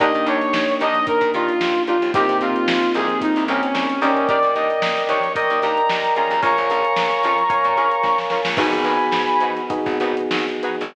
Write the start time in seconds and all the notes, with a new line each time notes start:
0.00 D#2 A#3 D4 D#4 G4 A#4 D#5, kick, closed hi-hat
0.14 D#3, closed hi-hat
0.26 D#2 D4 D#4 G4 A#4 C#5, closed hi-hat
0.41 snare, closed hi-hat
0.53 D#2, snare
0.68 closed hi-hat
0.80 D#2 D4 D#4 G4 A#4 D#5, closed hi-hat
0.95 closed hi-hat
1.07 A#4, kick, closed hi-hat
1.21 A#2, kick, closed hi-hat
1.33 D#3 D4 D#4 F4 G4 A#4, closed hi-hat
1.48 closed hi-hat
1.61 D#2, snare
1.75 closed hi-hat
1.87 D4 D#4 F4 G4 A#4, closed hi-hat
2.02 D#2, closed hi-hat
2.14 C2 A#3 C4 D#4 G4 A#4, kick, closed hi-hat
2.29 C3, closed hi-hat
2.41 C3 C4 D#4 F4 G4 A#4, closed hi-hat
2.56 closed hi-hat
2.68 C2, snare
2.82 closed hi-hat
2.94 C2 C4 D#4 G4 G#4 A#4, closed hi-hat
3.09 closed hi-hat
3.21 D#4, kick, closed hi-hat
3.36 C2, closed hi-hat
3.48 C2 C4 C#4 D#4 G4 A#4, snare, closed hi-hat
3.63 snare, closed hi-hat
3.75 C2, snare
3.90 closed hi-hat
4.01 D#2 C4 C#4 D#4 G4 A#4 D5 D#5 G5, snare, closed hi-hat
4.16 snare, closed hi-hat
4.28 D4 D#4 G4 A#4 D5, kick, closed hi-hat
4.43 A#2, closed hi-hat
4.55 D#2 D4 D#4 G4 A#4 D#5, closed hi-hat
4.70 closed hi-hat
4.82 A#2, snare
4.97 closed hi-hat
5.08 D#2 D4 D#4 G4 A#4 C#5, snare, closed hi-hat
5.23 closed hi-hat
5.35 A#4 D5 D#5 G5, kick, closed hi-hat
5.50 D#2, closed hi-hat
5.62 D#2 D4 D#4 G4 A#4 A#5, snare, closed hi-hat
5.77 closed hi-hat
5.90 D#2, snare
6.03 snare, closed hi-hat
6.16 C#4 F4 G#4 A#4 A#5, snare, closed hi-hat
6.31 D#2, closed hi-hat
6.42 A#1 A#4 C#5 F5 G#5 A#5 C#6, kick, closed hi-hat
6.57 A#1, closed hi-hat
6.70 A#1 C#4 F4 G#4 A#4, snare, closed hi-hat
6.84 closed hi-hat
6.96 A#1, snare
7.11 closed hi-hat
7.23 F2 C#4 F4 G#4 A#4, closed hi-hat
7.38 closed hi-hat
7.50 A#4 C#5 F5 G#5, kick, closed hi-hat
7.64 A#2, closed hi-hat
7.77 A#1 C#4 F4 G#4 A#4, closed hi-hat
7.91 closed hi-hat
8.03 A#1, kick, snare
8.18 snare
8.30 C#4 F4 G#4 A#4, snare
8.45 A#1, snare
8.57 G#1 B3 D#4 F#4 G#4 B4 G#5 B5, kick, crash
8.72 G#1, snare, closed hi-hat
8.84 G#1 D#4 F#4 G#4 B4, closed hi-hat
8.99 closed hi-hat
9.12 G#2, snare
9.28 closed hi-hat
9.40 G#2 D#4 F#4 G#4 B4, closed hi-hat
9.57 closed hi-hat
9.70 B3 D#4 F#4 G#4, kick, closed hi-hat
9.86 G#1, kick, closed hi-hat
10.00 G#1 D#4 F#4 G#4 B4, closed hi-hat
10.17 closed hi-hat
10.31 G#1, snare
10.48 closed hi-hat
10.63 D#4 F#4 G#4 B4, closed hi-hat
10.81 G#1, closed hi-hat